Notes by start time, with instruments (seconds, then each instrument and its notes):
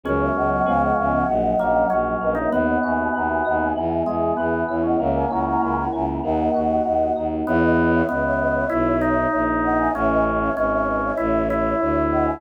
0.03 violin C#2, electric piano 1 F#3 G#3 B3 C#4, drawbar organ C#4, flute A#4 C#5
0.21 flute C#5 E5
0.35 violin C#2, flute D#5 F#5
0.51 flute D#5 F#5
0.66 violin C#2, electric piano 1 F3 G#3 B3 C#4, flute F5 G#5
0.81 flute D#5 F#5
0.98 violin C#2, flute E5
1.12 flute D#5 F#5
1.28 violin A#1, electric piano 1 F#3
1.59 violin A#1, drawbar organ A#3, electric piano 1 C#4
1.90 violin A#1, electric piano 1 F#3, drawbar organ C#4
2.21 violin A#1, electric piano 1 A#3, flute B4 D#5
2.35 drawbar organ D#4, flute C#5 E5
2.51 violin D#2, electric piano 1 B3, drawbar organ B3, flute B4 D#5
2.67 flute D#5 F#5
2.83 violin D#2, electric piano 1 F#4, flute E5 G#5
2.98 flute E5 G#5
3.14 violin D#2, electric piano 1 B3, flute F#5 A#5
3.29 flute E5 G#5
3.45 violin D#2, electric piano 1 D#4, flute D#5 F#5
3.60 flute E5 G#5
3.76 violin E2, electric piano 1 B3
4.06 violin E2, drawbar organ G#3, electric piano 1 G#4
4.37 violin E2, drawbar organ B3, electric piano 1 B3
4.68 violin E2, electric piano 1 E4, flute C#5 E5
4.83 drawbar organ C#4, flute D#5 F#5
4.99 violin C#2, drawbar organ A#3, electric piano 1 A#3, flute C#5 E5
5.15 flute E5 G#5
5.30 violin C#2, drawbar organ C#4, electric piano 1 E4, flute F#5 A#5
5.47 flute F#5 A#5
5.62 violin C#2, electric piano 1 A#3, flute G#5 B5
5.77 flute F#5 A#5
5.93 violin C#2, electric piano 1 C#4, flute E5 G#5
6.23 violin D#2, electric piano 1 A#3, flute D#5 F#5
6.54 violin D#2, electric piano 1 F#4
6.85 violin D#2, electric piano 1 A#3
7.16 violin D#2, electric piano 1 D#4
7.47 violin E2, drawbar organ B3, flute C#5 E5
7.62 flute B4 D#5
7.93 flute C#5 E5
8.09 violin C#2, drawbar organ B3, flute B4 D#5
8.24 flute C#5 E5
8.39 flute B4 D#5
8.55 flute C#5 E5
8.69 violin B1, drawbar organ E4
9.01 drawbar organ D#4
9.33 violin A#1
9.63 flute D#5 F#5
9.78 flute E5 G#5
9.94 violin A1, drawbar organ C#4, flute C#5 E5
10.09 flute B4 D#5
10.40 flute C#5 E5
10.56 violin G#1, drawbar organ C#4, flute B4 D#5
10.72 flute C#5 E5
10.87 flute B4 D#5
11.03 flute C#5 E5
11.17 violin A1, drawbar organ E4
11.50 drawbar organ E4
11.80 violin D2
12.11 flute D#5 F#5
12.26 flute E5 G#5